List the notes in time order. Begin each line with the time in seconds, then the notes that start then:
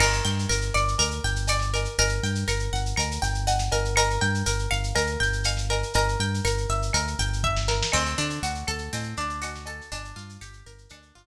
0.00 G1 A#4, crash, cowbell, claves
0.13 shaker
0.25 G2 G5, shaker
0.39 shaker
0.49 G1 A#4, shaker
0.61 shaker
0.74 G1 D5, claves, shaker
0.88 shaker
0.98 D2 A#4, cowbell, shaker
1.11 shaker
1.24 G1 G5, shaker
1.36 shaker
1.47 D5, cowbell, claves, shaker
1.59 snare, shaker
1.74 A#4, cowbell, shaker
1.85 shaker
1.98 G1 A#4, cowbell, shaker
2.09 shaker
2.23 G2 G5, shaker
2.35 shaker
2.48 G1 A#4, claves, shaker
2.59 shaker
2.73 G1 F#5, shaker
2.86 shaker
2.96 D2 A#4, cowbell, claves, shaker
3.11 shaker
3.22 G1 G5, shaker
3.35 shaker
3.47 F#5, cowbell, shaker
3.59 snare, shaker
3.71 G1 A#4, cowbell, shaker
3.85 shaker
3.96 A#4, cowbell, claves, shaker
4.10 shaker
4.21 G2 G5, shaker
4.34 shaker
4.46 G1 A#4, shaker
4.59 shaker
4.71 G1 F5, claves, shaker
4.84 shaker
4.95 D2 A#4, cowbell, shaker
5.07 shaker
5.20 G1 G5, shaker
5.33 shaker
5.44 F5, cowbell, claves, shaker
5.57 snare, shaker
5.70 A#4, cowbell, shaker
5.83 shaker
5.94 G1 A#4, cowbell, shaker
6.08 shaker
6.20 G2 G5, shaker
6.34 shaker
6.45 G1 A#4, claves, shaker
6.58 shaker
6.69 G1 E5, shaker
6.82 shaker
6.93 D2 A#4, cowbell, claves, shaker
7.07 shaker
7.19 G1 G5, shaker
7.33 shaker
7.44 E5, kick
7.57 snare
7.68 A#4, snare
7.83 snare
7.92 D2 C4, crash, cowbell, claves
8.06 shaker
8.18 D3 D4, shaker
8.30 shaker
8.43 D2 F#4, shaker
8.55 shaker
8.67 D2 A4, claves, shaker
8.78 shaker
8.93 A2 C4, cowbell, shaker
9.03 shaker
9.17 D2 D4, shaker
9.30 shaker
9.42 F#4, cowbell, claves, shaker
9.55 snare, shaker
9.66 A4, cowbell, shaker
9.81 shaker
9.92 G1 D4, cowbell, shaker
10.05 shaker
10.16 G2 F4, shaker
10.29 shaker
10.41 G1 G4, claves, shaker
10.53 shaker
10.66 G1 A#4, shaker
10.78 shaker
10.89 D2 D4, cowbell, claves, shaker
11.02 shaker
11.15 G1 F4, shaker